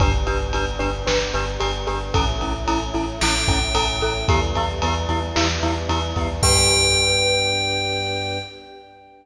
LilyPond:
<<
  \new Staff \with { instrumentName = "Tubular Bells" } { \time 4/4 \key g \lydian \tempo 4 = 112 r1 | r2 g''2 | r1 | g''1 | }
  \new Staff \with { instrumentName = "Glockenspiel" } { \time 4/4 \key g \lydian <d' g' b'>8 <d' g' b'>8 <d' g' b'>8 <d' g' b'>8 <d' g' b'>8 <d' g' b'>8 <d' g' b'>8 <d' g' b'>8 | <cis' e' a'>8 <cis' e' a'>8 <cis' e' a'>8 <cis' e' a'>8 <cis' e' a'>8 <cis' e' a'>8 <cis' e' a'>8 <cis' e' a'>8 | <b e' g'>8 <b e' g'>8 <b e' g'>8 <b e' g'>8 <b e' g'>8 <b e' g'>8 <b e' g'>8 <b e' g'>8 | <d' g' b'>1 | }
  \new Staff \with { instrumentName = "Synth Bass 2" } { \clef bass \time 4/4 \key g \lydian g,,8 g,,8 g,,8 g,,8 g,,8 g,,8 g,,8 g,,8 | a,,8 a,,8 a,,8 a,,8 a,,8 a,,8 a,,8 a,,8 | e,8 e,8 e,8 e,8 e,8 e,8 e,8 e,8 | g,1 | }
  \new Staff \with { instrumentName = "Choir Aahs" } { \time 4/4 \key g \lydian <b d' g'>1 | <a cis' e'>1 | <g b e'>1 | <b d' g'>1 | }
  \new DrumStaff \with { instrumentName = "Drums" } \drummode { \time 4/4 <bd cymr>8 cymr8 cymr8 cymr8 sn8 cymr8 cymr8 cymr8 | <bd cymr>8 cymr8 cymr8 cymr8 sn8 <bd cymr>8 cymr8 cymr8 | <bd cymr>8 cymr8 cymr8 cymr8 sn8 cymr8 cymr8 <bd cymr>8 | <cymc bd>4 r4 r4 r4 | }
>>